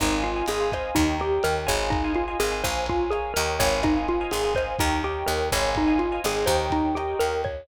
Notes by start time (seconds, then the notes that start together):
0.00 G#1 D#4 C5 D#5 F5 G#5, kick, cross-stick, closed hi-hat
0.12 C5 D#5 F5 G#5
0.22 F4, closed hi-hat
0.36 C5 D#5 F5 G#5
0.46 G#1 G#4 C5 D#5 F5 G#5, closed hi-hat
0.60 C5 D#5 F5 G#5
0.72 C5 D#5 F5 G#5, kick, cross-stick, closed hi-hat
0.95 D#2 D#4 A#4 C#5 D#5 G5, kick, closed hi-hat
1.20 G4 A#4 C#5 D#5 G5, closed hi-hat
1.43 D#2 A#4, cross-stick, closed hi-hat
1.67 G#1 C5 C#5 D#5 F5 G#5, kick, closed hi-hat
1.90 D#4, kick, closed hi-hat
2.04 C5 D#5 F5 G#5
2.15 F4, closed hi-hat
2.28 C5 D#5 F5 G#5
2.39 G#1 G#4 C5 D#5 F5 G#5, cross-stick, closed hi-hat
2.52 C5 D#5 F5 G#5
2.63 A#1 A#4 C5 C#5 F5 G#5, kick, closed hi-hat
2.86 F4, kick, closed hi-hat
3.10 G#4 A#4 C#5 F5 G#5, cross-stick, closed hi-hat
3.34 D#2 A#4 C#5 D#5 G5, closed hi-hat
3.59 G#1 C5 C#5 D#5 F5 G#5, kick, closed hi-hat
3.83 D#4, kick, cross-stick, closed hi-hat
3.96 C5 D#5 F5 G#5
4.08 F4, closed hi-hat
4.21 C5 D#5 F5 G#5
4.31 G#1 G#4 C5 D#5 F5 G#5, closed hi-hat
4.44 C5 D#5 F5 G#5
4.55 C5 D#5 F5 G#5, kick, cross-stick, closed hi-hat
4.79 D#2 D#4 A#4 C#5 D#5 G5, kick, closed hi-hat
5.04 G4 A#4 C#5 D#5 G5, closed hi-hat
5.26 D#2 A#4, cross-stick, closed hi-hat
5.52 G#1 C5 C#5 D#5 F5 G#5, kick, open hi-hat
5.75 D#4, kick, closed hi-hat
5.87 C5 D#5 F5 G#5
5.99 F4, closed hi-hat
6.12 C5 D#5 F5 G#5
6.24 G#1 G#4 C5 D#5 F5 G#5, cross-stick, closed hi-hat
6.36 C5 D#5 F5 G#5
6.46 D#2 A#4 C5 C#5 D#5 G5, kick, closed hi-hat
6.70 D#4, kick, closed hi-hat
6.95 G4 A#4 C#5 D#5 G5, cross-stick, closed hi-hat
7.19 D#2 A#4, closed hi-hat
7.44 C#5, kick, closed hi-hat